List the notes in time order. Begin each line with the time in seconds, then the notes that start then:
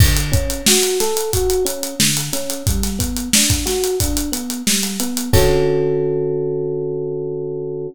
0.00 D3, kick, crash
0.17 closed hi-hat
0.32 C#4, kick, closed hi-hat
0.50 closed hi-hat
0.66 F#4, snare
0.83 closed hi-hat
1.00 A4, snare, closed hi-hat
1.17 closed hi-hat
1.33 F#4, kick, closed hi-hat
1.50 closed hi-hat
1.65 C#4, closed hi-hat
1.83 closed hi-hat
2.00 D3, snare
2.17 closed hi-hat
2.33 C#4, snare, closed hi-hat
2.50 closed hi-hat
2.67 G3, kick, closed hi-hat
2.83 snare, closed hi-hat
2.99 B3, kick, closed hi-hat
3.17 closed hi-hat
3.33 D4, snare
3.50 kick, closed hi-hat
3.66 F#4, snare, closed hi-hat
3.84 closed hi-hat
4.00 D4, kick, closed hi-hat
4.17 closed hi-hat
4.32 B3, closed hi-hat
4.50 closed hi-hat
4.67 G3, snare
4.83 closed hi-hat
5.00 B3, closed hi-hat
5.17 closed hi-hat
5.33 D3 C#4 F#4 A4, kick, crash